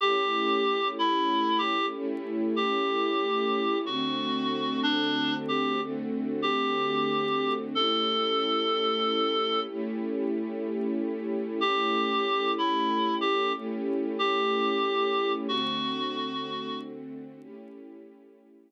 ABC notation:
X:1
M:4/4
L:1/8
Q:"Swing" 1/4=62
K:A
V:1 name="Clarinet"
=G2 E G z G3 | F2 D =G z G3 | A4 z4 | =G2 E G z G3 |
F3 z5 |]
V:2 name="String Ensemble 1"
[A,CE=G]4 [A,CEG]4 | [D,A,=CF]4 [D,A,CF]4 | [A,CE=G]4 [A,CEG]4 | [A,CE=G]4 [A,CEG]4 |
[D,A,=CF]4 [A,^CE=G]4 |]